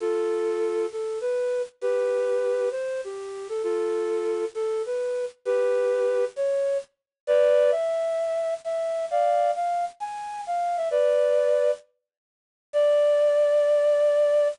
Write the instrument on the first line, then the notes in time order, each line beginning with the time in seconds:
flute
0.00 F4 A4
0.92 A4
1.21 B4
1.81 G4 B4
2.71 C5
3.04 G4
3.49 A4
3.63 F4 A4
4.55 A4
4.86 B4
5.45 G4 B4
6.36 C#5
7.27 B4 D5
7.71 E5
8.64 E5
9.11 D5 F5
9.56 F5
10.00 G#5
10.47 F5
10.77 E5
10.91 B4 D5
12.73 D5